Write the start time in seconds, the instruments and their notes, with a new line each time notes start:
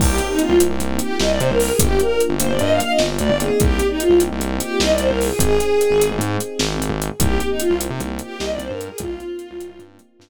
0.00 synth bass 1 C2, electric piano 1 A#3 C4 D#4 G4, violin G4, kick, crash
0.18 closed hi-hat
0.30 violin D#4
0.39 violin F4, closed hi-hat
0.49 synth bass 1 C2
0.60 electric piano 1 A#3 C4 D#4 G4, closed hi-hat
0.70 synth bass 1 C2
0.80 synth bass 1 C2, closed hi-hat
0.99 violin G4, closed hi-hat
1.20 synth bass 1 C2, violin D#5, snare
1.30 violin D5
1.40 synth bass 1 C3, violin C5, closed hi-hat
1.50 synth bass 1 C2, violin A#4
1.60 violin A#4, open hi-hat
1.70 violin G#4
1.79 synth bass 1 G1, electric piano 1 A#3 D4 F4 G4, violin G4, kick, closed hi-hat
2.00 violin A#4, closed hi-hat
2.20 closed hi-hat
2.29 synth bass 1 G1
2.40 electric piano 1 A#3 D4 F4 G4, violin C5, closed hi-hat
2.49 synth bass 1 G1, violin D5
2.59 synth bass 1 G2, violin D#5, closed hi-hat
2.70 violin F5
2.80 violin F5, closed hi-hat
2.90 violin D#5
2.99 synth bass 1 G1, snare
3.19 synth bass 1 D2, violin D5, closed hi-hat
3.30 synth bass 1 G1
3.39 electric piano 1 A#3 C4 D#4 G4, violin G#4, closed hi-hat
3.60 synth bass 1 C2, violin G4, kick, closed hi-hat
3.79 closed hi-hat
3.90 violin D#4
4.00 violin F4, closed hi-hat
4.10 synth bass 1 C2
4.20 electric piano 1 A#3 C4 D#4 G4, closed hi-hat
4.31 synth bass 1 C2
4.40 synth bass 1 C2, closed hi-hat
4.60 violin G4, closed hi-hat
4.80 synth bass 1 C2, violin D#5, snare
4.90 violin D5
4.98 synth bass 1 C2, violin C5, closed hi-hat
5.09 synth bass 1 C2, violin A#4
5.21 violin G#4, open hi-hat
5.30 violin G#4
5.39 synth bass 1 G#1, electric piano 1 C4 D#4 G4 G#4, violin G#4, kick, closed hi-hat
5.60 closed hi-hat
5.81 closed hi-hat
5.91 synth bass 1 G#1
6.00 electric piano 1 C4 D#4 G4 G#4, closed hi-hat
6.11 synth bass 1 G#1
6.19 synth bass 1 G#2, closed hi-hat
6.40 closed hi-hat
6.59 synth bass 1 G#1, snare
6.80 synth bass 1 G#1, closed hi-hat
6.90 synth bass 1 G#1
7.02 closed hi-hat
7.20 synth bass 1 C2, electric piano 1 A#3 C4 D#4 G4, violin G4, kick, closed hi-hat
7.40 closed hi-hat
7.50 violin D#4
7.60 violin F4, closed hi-hat
7.70 synth bass 1 C2
7.80 electric piano 1 A#3 C4 D#4 G4, closed hi-hat
7.90 synth bass 1 C3
8.00 synth bass 1 C2, closed hi-hat
8.19 violin G4, closed hi-hat
8.40 synth bass 1 C2, violin D#5, snare
8.50 violin D5
8.59 synth bass 1 C2, violin C5, closed hi-hat
8.70 synth bass 1 G2, violin A#4
8.79 violin A#4, closed hi-hat
8.90 violin G#4
8.98 synth bass 1 C2, electric piano 1 A#3 C4 D#4 G4, violin F4, kick, closed hi-hat
9.20 closed hi-hat
9.39 closed hi-hat
9.51 synth bass 1 C2
9.60 electric piano 1 A#3 C4 D#4 G4, closed hi-hat
9.69 synth bass 1 C2
9.79 synth bass 1 G2, closed hi-hat
9.99 closed hi-hat
10.19 synth bass 1 G2, snare